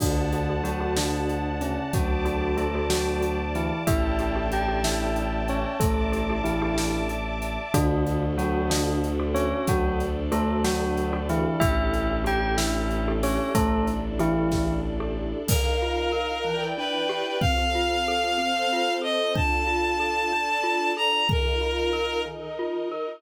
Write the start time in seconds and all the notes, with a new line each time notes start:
0.00 D2 D3 D4 F#4 A4 D5 F#5 A5, kick, crash
0.33 D4 F#4 A4, closed hi-hat
0.49 D4 F#4 A4
0.63 F#3 F#4, closed hi-hat
0.80 D4 F#4 A4
0.97 D3 D4, snare
1.29 closed hi-hat
1.61 C#3 C#4, closed hi-hat
1.92 D2 F#3 F#4 D5 A5 D6, kick, closed hi-hat
2.25 D4 F#4 A4, closed hi-hat
2.41 D4 F#4 A4
2.57 A3 A4, closed hi-hat
2.75 D4 F#4 A4
2.90 F#3 F#4, snare
3.22 closed hi-hat
3.55 E3 E4, closed hi-hat
3.87 A1 D4 E4 G4 A4 D5 E5 G5 A5, kick, closed hi-hat
4.19 D4 E4 G4 A4, closed hi-hat
4.35 D4 E4 G4 A4
4.52 G4 G5, closed hi-hat
4.68 D4 E4 G4 A4
4.84 E4 E5, snare
5.16 closed hi-hat
5.48 C#4 C#5, closed hi-hat
5.80 A1 A3 A4 D5 E5 A5 D6, kick, closed hi-hat
6.12 D4 E4 G4 A4, closed hi-hat
6.30 D4 E4 G4 A4
6.44 E3 E4, closed hi-hat
6.62 D4 E4 G4 A4
6.78 snare
7.09 closed hi-hat
7.42 closed hi-hat
7.74 D2 D3 D4 F#4 A4, kick, closed hi-hat
8.07 closed hi-hat
8.38 F#3 D4 F#4 A4, closed hi-hat
8.70 D3 D4, snare
9.04 closed hi-hat
9.19 D4 F#4 A4
9.34 C#4 C#5, closed hi-hat
9.67 D2 F#3 D4 F#4 A4 D5, kick, closed hi-hat
10.00 closed hi-hat
10.32 A3 D4 F#4 A4, closed hi-hat
10.64 F#3 F#4, snare
10.97 closed hi-hat
11.13 D4 F#4 A4
11.29 E3 E4, closed hi-hat
11.60 A1 D4 E4 G4 A4 E5, kick, closed hi-hat
11.94 closed hi-hat
12.24 D4 E4 G4 A4 G5, closed hi-hat
12.57 E4 E5, snare
12.91 closed hi-hat
13.08 D4 E4 G4 A4
13.23 C#4 C#5, open hi-hat
13.55 A1 A3 D4 E4 A4 D5, kick, closed hi-hat
13.87 closed hi-hat
14.19 E3 D4 E4 G4 A4, closed hi-hat
14.51 kick, snare
15.00 D4 E4 G4 A4
15.48 D#3 D#4 A#4 F5, kick, crash
15.82 F4
16.12 A#4
16.45 E3 E4 B4 D5 G5
16.77 D4 B4
17.09 G4
17.41 C4 F4 A4 F5, kick
17.75 F4
18.08 A4
18.38 C4 A4 C5
18.73 F4
19.02 A4 D#5
19.35 D4 F4 A4 A5, kick
19.67 F4
20.00 A4
20.32 D4 A4 D5
20.63 F4
20.97 A4 A#5
21.28 D#3 D#4 F4 A#4, kick
21.61 F4
21.93 A#4
22.26 D#3 D#4 A#4 D#5
22.59 F4
22.92 A#4